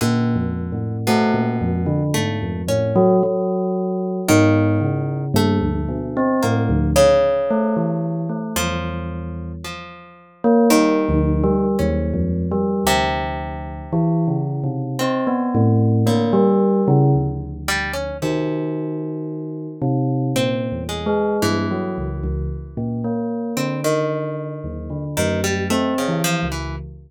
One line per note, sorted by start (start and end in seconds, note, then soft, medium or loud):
0.01 0.34 A#2 loud
0.01 0.97 D3 medium
0.35 0.68 F2 medium
0.72 1.04 A2 medium
1.07 2.03 B2 medium
1.07 1.32 A3 loud
1.34 1.58 A#2 medium
1.61 1.85 F2 medium
1.86 2.10 D3 medium
2.14 2.39 G#2 medium
2.14 2.62 A3 loud
2.42 2.66 F2 medium
2.68 2.92 A2 medium
2.68 3.17 C#4 medium
2.96 3.20 F#3 loud
3.23 4.20 F#3 medium
4.28 4.78 G#2 loud
4.28 5.25 D#3 loud
4.81 5.29 C#3 medium
5.34 5.58 G2 loud
5.34 6.33 A3 loud
5.61 5.85 D2 medium
5.88 6.13 B2 medium
6.17 6.41 C4 medium
6.43 6.68 A2 medium
6.43 6.91 A#3 medium
6.69 6.93 D2 loud
6.96 8.40 C#3 loud
7.50 7.75 A3 medium
7.77 8.25 E3 medium
8.29 8.54 A3 medium
8.56 9.53 E2 medium
8.56 9.52 F3 loud
9.65 10.61 F3 medium
10.44 10.68 A#3 loud
10.70 11.67 D#3 loud
10.70 11.04 G3 medium
11.09 11.41 D2 loud
11.44 11.76 G3 loud
11.79 12.12 D#2 loud
11.79 12.75 C#4 medium
12.14 12.46 F2 medium
12.52 12.84 G3 medium
12.84 13.81 D2 medium
12.84 14.79 C3 loud
13.93 14.25 E3 loud
14.28 14.60 C#3 medium
14.64 14.96 C3 medium
14.99 15.96 C4 medium
14.99 15.25 C4 medium
15.27 15.51 B3 medium
15.55 16.03 A2 loud
16.06 17.51 D3 medium
16.06 16.30 A#3 medium
16.33 16.81 G3 loud
16.88 17.12 C#3 loud
17.15 18.11 D2 medium
17.68 17.92 G3 loud
17.93 18.17 C#4 medium
18.22 20.15 C3 soft
18.22 19.67 D#3 medium
19.82 20.30 C3 medium
20.36 20.68 A#2 medium
20.36 20.84 C4 medium
20.72 21.04 E2 medium
20.89 21.37 G#3 medium
21.06 21.38 G#3 medium
21.42 21.67 G2 medium
21.42 23.35 E3 medium
21.71 21.95 F#3 medium
21.98 22.22 C#2 medium
22.23 22.48 C#2 medium
22.77 23.01 A#2 medium
23.04 23.53 A#3 medium
23.57 24.54 D3 medium
23.57 23.81 C4 medium
23.84 25.05 D#3 medium
24.64 24.88 D#2 medium
24.90 25.14 D3 medium
25.17 25.67 F#2 medium
25.17 25.41 D#3 loud
25.44 25.68 G3 medium
25.70 25.94 A3 medium
25.70 26.03 C4 medium
25.98 26.22 C#3 medium
26.08 26.40 E3 medium
26.24 26.48 F3 loud
26.43 26.75 C#2 medium
26.52 26.76 E3 medium